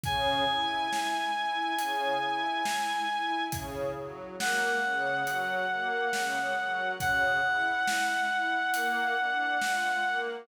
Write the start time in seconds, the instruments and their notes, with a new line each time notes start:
0.03 string ensemble 1 C#3, clarinet G#5, kick, closed hi-hat
0.48 string ensemble 1 E4
0.92 string ensemble 1 E4, snare
1.35 string ensemble 1 E4
1.79 string ensemble 1 C#3, closed hi-hat
2.22 string ensemble 1 E4
2.65 string ensemble 1 E4, snare
3.09 string ensemble 1 E4
3.52 string ensemble 1 C#3, kick, closed hi-hat
3.96 string ensemble 1 F#3
4.39 string ensemble 1 A#3, clarinet F#5, snare
4.83 string ensemble 1 C#3
5.27 string ensemble 1 F#3, closed hi-hat
5.70 string ensemble 1 A#3
6.13 string ensemble 1 C#3, snare
6.57 string ensemble 1 F#3
7.00 string ensemble 1 C#3, clarinet F#5, kick, closed hi-hat
7.44 string ensemble 1 E4
7.87 string ensemble 1 E4, snare
8.31 string ensemble 1 E4
8.74 string ensemble 1 A#3, closed hi-hat
9.18 string ensemble 1 D4
9.61 string ensemble 1 F4, snare
10.05 string ensemble 1 A#3